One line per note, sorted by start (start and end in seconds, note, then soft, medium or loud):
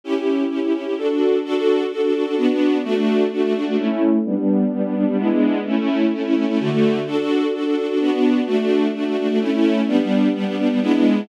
0.04 0.13 C#4 loud
0.04 0.13 E4 loud
0.04 0.13 G4 loud
0.16 0.44 C#4 medium
0.16 0.44 E4 medium
0.16 0.44 G4 medium
0.50 0.59 C#4 medium
0.50 0.59 E4 medium
0.50 0.59 G4 medium
0.63 0.72 C#4 medium
0.63 0.72 E4 medium
0.63 0.72 G4 medium
0.74 0.84 C#4 medium
0.74 0.84 E4 medium
0.74 0.84 G4 medium
0.85 0.94 C#4 medium
0.85 0.94 E4 medium
0.85 0.94 G4 medium
0.98 1.07 D4 medium
0.98 1.07 F#4 medium
0.98 1.07 A4 loud
1.10 1.38 D4 medium
1.10 1.38 F#4 medium
1.10 1.38 A4 medium
1.45 1.54 D4 loud
1.45 1.54 F#4 loud
1.45 1.54 A4 loud
1.55 1.84 D4 medium
1.55 1.84 F#4 loud
1.55 1.84 A4 medium
1.92 2.01 D4 medium
1.92 2.01 F#4 loud
1.92 2.01 A4 loud
2.03 2.13 D4 medium
2.03 2.13 F#4 medium
2.03 2.13 A4 loud
2.14 2.24 D4 medium
2.14 2.24 F#4 loud
2.14 2.24 A4 medium
2.26 2.35 D4 medium
2.26 2.35 F#4 medium
2.26 2.35 A4 medium
2.37 2.47 B3 loud
2.37 2.47 D4 loud
2.37 2.47 F#4 loud
2.50 2.78 B3 loud
2.50 2.78 D4 loud
2.50 2.78 F#4 medium
2.84 2.94 A3 loud
2.84 2.94 D4 loud
2.84 2.94 F#4 loud
2.96 3.24 A3 loud
2.96 3.24 D4 loud
2.96 3.24 F#4 medium
3.32 3.41 A3 loud
3.32 3.41 D4 medium
3.32 3.41 F#4 loud
3.44 3.53 A3 loud
3.44 3.53 D4 medium
3.44 3.53 F#4 medium
3.55 3.64 A3 medium
3.55 3.64 D4 loud
3.55 3.64 F#4 medium
3.67 3.76 A3 medium
3.67 3.76 D4 loud
3.67 3.76 F#4 medium
3.79 3.88 A3 loud
3.79 3.88 C#4 loud
3.79 3.88 E4 loud
3.90 4.18 A3 loud
3.90 4.18 C#4 loud
3.90 4.18 E4 loud
4.25 4.35 G3 loud
4.25 4.35 B3 loud
4.25 4.35 D4 loud
4.36 4.65 G3 loud
4.36 4.65 B3 medium
4.36 4.65 D4 medium
4.72 4.82 G3 loud
4.72 4.82 B3 loud
4.72 4.82 D4 medium
4.85 4.94 G3 medium
4.85 4.94 B3 loud
4.85 4.94 D4 loud
4.95 5.05 G3 loud
4.95 5.05 B3 medium
4.95 5.05 D4 loud
5.08 5.17 G3 medium
5.08 5.17 B3 loud
5.08 5.17 D4 medium
5.18 5.28 G#3 loud
5.18 5.28 B3 loud
5.18 5.28 D4 loud
5.18 5.28 E4 loud
5.30 5.59 G#3 loud
5.30 5.59 B3 loud
5.30 5.59 D4 medium
5.30 5.59 E4 medium
5.66 5.75 A3 loud
5.66 5.75 C#4 loud
5.66 5.75 E4 loud
5.77 6.05 A3 medium
5.77 6.05 C#4 loud
5.77 6.05 E4 loud
6.13 6.22 A3 medium
6.13 6.22 C#4 medium
6.13 6.22 E4 medium
6.25 6.34 A3 medium
6.25 6.34 C#4 loud
6.25 6.34 E4 loud
6.36 6.45 A3 medium
6.36 6.45 C#4 loud
6.36 6.45 E4 medium
6.48 6.58 A3 loud
6.48 6.58 C#4 loud
6.48 6.58 E4 loud
6.60 6.69 D3 loud
6.60 6.69 A3 loud
6.60 6.69 F#4 loud
6.71 6.99 D3 loud
6.71 6.99 A3 loud
6.71 6.99 F#4 medium
7.07 7.16 D4 loud
7.07 7.16 F#4 loud
7.07 7.16 A4 loud
7.18 7.46 D4 medium
7.18 7.46 F#4 loud
7.18 7.46 A4 medium
7.54 7.63 D4 medium
7.54 7.63 F#4 loud
7.54 7.63 A4 loud
7.66 7.75 D4 medium
7.66 7.75 F#4 medium
7.66 7.75 A4 loud
7.77 7.86 D4 medium
7.77 7.86 F#4 loud
7.77 7.86 A4 medium
7.89 7.98 D4 medium
7.89 7.98 F#4 medium
7.89 7.98 A4 medium
8.00 8.10 B3 loud
8.00 8.10 D4 loud
8.00 8.10 F#4 loud
8.12 8.40 B3 loud
8.12 8.40 D4 loud
8.12 8.40 F#4 medium
8.47 8.56 A3 loud
8.47 8.56 D4 loud
8.47 8.56 F#4 loud
8.59 8.87 A3 loud
8.59 8.87 D4 loud
8.59 8.87 F#4 medium
8.94 9.04 A3 loud
8.94 9.04 D4 medium
8.94 9.04 F#4 loud
9.07 9.16 A3 loud
9.07 9.16 D4 medium
9.07 9.16 F#4 medium
9.18 9.27 A3 medium
9.18 9.27 D4 loud
9.18 9.27 F#4 medium
9.29 9.39 A3 medium
9.29 9.39 D4 loud
9.29 9.39 F#4 medium
9.41 9.50 A3 loud
9.41 9.50 C#4 loud
9.41 9.50 E4 loud
9.53 9.81 A3 loud
9.53 9.81 C#4 loud
9.53 9.81 E4 loud
9.88 9.97 G3 loud
9.88 9.97 B3 loud
9.88 9.97 D4 loud
10.00 10.28 G3 loud
10.00 10.28 B3 medium
10.00 10.28 D4 medium
10.35 10.44 G3 loud
10.35 10.44 B3 loud
10.35 10.44 D4 medium
10.46 10.56 G3 medium
10.46 10.56 B3 loud
10.46 10.56 D4 loud
10.58 10.68 G3 loud
10.58 10.68 B3 medium
10.58 10.68 D4 loud
10.70 10.79 G3 medium
10.70 10.79 B3 loud
10.70 10.79 D4 medium
10.82 10.92 G#3 loud
10.82 10.92 B3 loud
10.82 10.92 D4 loud
10.82 10.92 E4 loud
10.93 11.21 G#3 loud
10.93 11.21 B3 loud
10.93 11.21 D4 medium
10.93 11.21 E4 medium